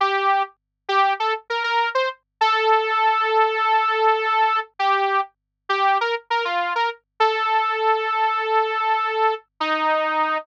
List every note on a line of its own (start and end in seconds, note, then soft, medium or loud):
0.01 0.43 G4 loud
0.89 1.14 G4 loud
1.20 1.34 A4 medium
1.50 1.63 A#4 medium
1.64 1.89 A#4 loud
1.95 2.09 C5 medium
2.41 4.60 A4 loud
4.79 5.21 G4 loud
5.69 5.98 G4 loud
6.01 6.15 A#4 medium
6.30 6.45 A#4 medium
6.45 6.73 F4 medium
6.75 6.90 A#4 medium
7.20 9.34 A4 loud
9.60 10.38 D#4 loud